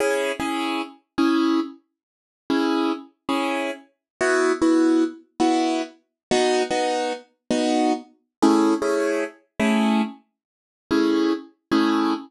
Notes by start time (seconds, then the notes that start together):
0.00 C#4 E4 G#4
0.40 C#4 E4 G#4
1.18 C#4 E4 G#4
2.50 C#4 E4 G#4
3.29 C#4 E4 G#4
4.21 B3 E4 F#4
4.62 B3 E4 F#4
5.40 B3 E4 F#4
6.31 B3 D#4 F#4
6.71 B3 D#4 F#4
7.51 B3 D#4 F#4
8.42 A3 C#4 E4 G#4
8.82 A3 C#4 E4 G#4
9.60 A3 C#4 E4 G#4
10.91 A3 C#4 E4 G#4
11.71 A3 C#4 E4 G#4